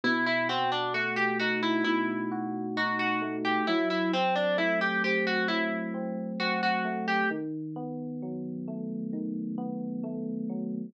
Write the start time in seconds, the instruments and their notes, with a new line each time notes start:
0.04 electric piano 1 B2, harpsichord E4
0.26 harpsichord E4
0.49 harpsichord C4, electric piano 1 F#4
0.72 harpsichord D4
0.94 electric piano 1 A3, harpsichord F#4
1.16 harpsichord G4
1.39 electric piano 1 D#4, harpsichord F#4
1.63 harpsichord E4
1.84 electric piano 1 B2, harpsichord E4
2.31 electric piano 1 F#4
2.77 electric piano 1 D#4, harpsichord F#4
2.99 harpsichord F#4
3.22 electric piano 1 A3
3.45 harpsichord G4
3.67 electric piano 1 F#3, harpsichord E4
3.90 harpsichord E4
4.13 electric piano 1 C4, harpsichord C4
4.35 harpsichord D4
4.57 electric piano 1 A3, harpsichord E4
4.81 harpsichord G4
5.04 electric piano 1 C4, harpsichord G4
5.27 harpsichord F#4
5.48 electric piano 1 F#3, harpsichord E4
5.94 electric piano 1 C4
6.40 electric piano 1 C4, harpsichord F#4
6.63 harpsichord F#4
6.85 electric piano 1 A3
7.08 harpsichord G4
7.30 electric piano 1 D#3
7.76 electric piano 1 B3
8.22 electric piano 1 F#3
8.68 electric piano 1 A3
9.13 electric piano 1 D#3
9.58 electric piano 1 B3
10.03 electric piano 1 A3
10.49 electric piano 1 F#3